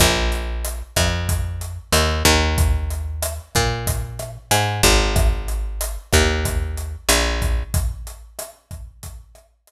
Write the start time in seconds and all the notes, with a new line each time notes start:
0.00 A#1, kick, cross-stick, closed hi-hat
0.32 closed hi-hat
0.65 closed hi-hat
0.96 F2, kick, cross-stick, closed hi-hat
1.29 kick, closed hi-hat
1.61 closed hi-hat
1.92 D#2, cross-stick, closed hi-hat
2.25 D#2, kick, closed hi-hat
2.58 kick, closed hi-hat
2.90 closed hi-hat
3.22 cross-stick, closed hi-hat
3.55 A#2, kick, closed hi-hat
3.87 kick, closed hi-hat
4.19 cross-stick, closed hi-hat
4.51 G#2, closed hi-hat
4.83 G#1, kick, closed hi-hat
5.16 kick, cross-stick, closed hi-hat
5.48 closed hi-hat
5.81 closed hi-hat
6.13 D#2, kick, cross-stick, closed hi-hat
6.45 kick, closed hi-hat
6.77 closed hi-hat
7.09 A#1, cross-stick, closed hi-hat
7.42 kick, closed hi-hat
7.74 kick, closed hi-hat
8.07 closed hi-hat
8.39 cross-stick, closed hi-hat
8.71 kick, closed hi-hat
9.03 kick, closed hi-hat
9.35 cross-stick, closed hi-hat
9.67 closed hi-hat